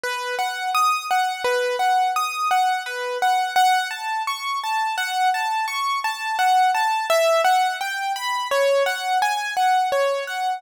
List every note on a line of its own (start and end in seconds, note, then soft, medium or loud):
0.03 0.35 B4 medium
0.39 0.70 F#5 medium
0.75 1.06 D#6 medium
1.11 1.42 F#5 medium
1.44 1.76 B4 medium
1.79 2.11 F#5 medium
2.16 2.48 D#6 medium
2.51 2.83 F#5 medium
2.86 3.18 B4 medium
3.22 3.54 F#5 medium
3.56 3.88 F#5 medium
3.91 4.22 A5 medium
4.27 4.59 C#6 medium
4.64 4.95 A5 medium
4.97 5.29 F#5 medium
5.34 5.66 A5 medium
5.68 5.99 C#6 medium
6.04 6.36 A5 medium
6.39 6.70 F#5 medium
6.74 7.06 A5 medium
7.10 7.41 E5 medium
7.44 7.76 F#5 medium
7.81 8.12 G5 medium
8.16 8.48 B5 medium
8.51 8.83 C#5 medium
8.86 9.18 F#5 medium
9.22 9.54 G#5 medium
9.57 9.88 F#5 medium
9.92 10.24 C#5 medium
10.27 10.59 F#5 medium